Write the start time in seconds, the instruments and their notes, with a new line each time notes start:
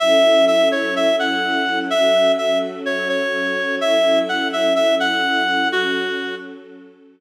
0.00 string ensemble 1 F#3 C#4 E4 A4, clarinet E5
0.47 clarinet E5
0.72 clarinet C#5
0.96 clarinet E5
1.19 clarinet F#5
1.90 string ensemble 1 F#3 C#4 F#4 A4, clarinet E5
2.38 clarinet E5
2.86 clarinet C#5
3.09 clarinet C#5
3.81 string ensemble 1 F#3 C#4 E4 A4, clarinet E5
4.29 clarinet F#5
4.53 clarinet E5
4.76 clarinet E5
5.00 clarinet F#5
5.71 string ensemble 1 F#3 C#4 F#4 A4, clarinet F#4